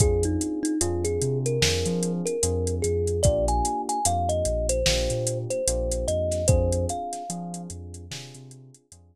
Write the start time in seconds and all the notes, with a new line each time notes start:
0.00 F2 C4 D4 F4 G#4, kick, closed hi-hat
0.23 D#4, closed hi-hat
0.41 closed hi-hat
0.63 D#4, closed hi-hat
0.81 F2 C4 D4 F4 G#4, closed hi-hat
1.04 G#4, closed hi-hat
1.22 C3, closed hi-hat
1.46 A#4, closed hi-hat
1.61 F2 C4 D4 F4 G#4, snare
1.86 F3, closed hi-hat
2.03 closed hi-hat
2.26 A#4, closed hi-hat
2.43 F2 C4 D4 F4 G#4, closed hi-hat
2.67 closed hi-hat
2.82 F2 G#4, closed hi-hat
3.07 closed hi-hat
3.23 A#1 A#3 D4 F4 G4 D5, kick, closed hi-hat
3.48 G#5, closed hi-hat
3.65 closed hi-hat
3.89 G#5, closed hi-hat
4.05 F2 A#3 D4 F4 G4 F5, closed hi-hat
4.29 D#5, closed hi-hat
4.45 A#1, closed hi-hat
4.69 C5, closed hi-hat
4.86 A#1 A#3 D4 F4 G4, snare
5.10 A#2, closed hi-hat
5.27 closed hi-hat
5.50 C5, closed hi-hat
5.67 A#1 A#3 D4 F4 G4, closed hi-hat
5.92 closed hi-hat
6.08 F2 D#5, closed hi-hat
6.31 snare, closed hi-hat
6.48 F2 C4 D4 F4 G#4 C5, kick, closed hi-hat
6.72 closed hi-hat
6.89 F5, closed hi-hat
7.13 snare, closed hi-hat
7.30 F3 C4 D4 F4 G#4, closed hi-hat
7.54 closed hi-hat
7.70 F2, closed hi-hat
7.94 closed hi-hat
8.11 C3 C4 D4 F4 G#4, snare
8.34 C3, closed hi-hat
8.51 closed hi-hat
8.74 closed hi-hat
8.92 F2 C4 D4 F4 G#4, closed hi-hat